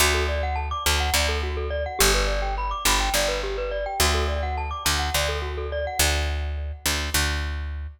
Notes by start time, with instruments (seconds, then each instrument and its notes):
0.00 electric bass (finger) D2, glockenspiel F#4
0.14 glockenspiel A4
0.29 glockenspiel D5
0.43 glockenspiel F#5
0.56 glockenspiel A5
0.71 glockenspiel D6
0.86 electric bass (finger) D2, glockenspiel A5
1.00 glockenspiel F#5
1.14 electric bass (finger) D2, glockenspiel D5
1.29 glockenspiel A4
1.43 glockenspiel F#4
1.57 glockenspiel A4
1.70 glockenspiel D5
1.86 glockenspiel F#5
1.99 electric bass (finger) G1, glockenspiel G4
2.15 glockenspiel B4
2.27 glockenspiel D5
2.42 glockenspiel G5
2.58 glockenspiel B5
2.71 glockenspiel D6
2.85 electric bass (finger) G1, glockenspiel B5
3.00 glockenspiel G5
3.14 electric bass (finger) G1, glockenspiel D5
3.28 glockenspiel B4
3.43 glockenspiel G4
3.58 glockenspiel B4
3.71 glockenspiel D5
3.86 glockenspiel G5
4.00 electric bass (finger) D2, glockenspiel F#4
4.14 glockenspiel A4
4.28 glockenspiel D5
4.43 glockenspiel F#5
4.58 glockenspiel A5
4.71 glockenspiel D6
4.85 electric bass (finger) D2, glockenspiel A5
4.99 glockenspiel F#5
5.14 electric bass (finger) D2, glockenspiel D5
5.29 glockenspiel A4
5.42 glockenspiel F#4
5.57 glockenspiel A4
5.72 glockenspiel D5
5.87 glockenspiel F#5
5.99 electric bass (finger) D2
6.86 electric bass (finger) D2
7.14 electric bass (finger) D2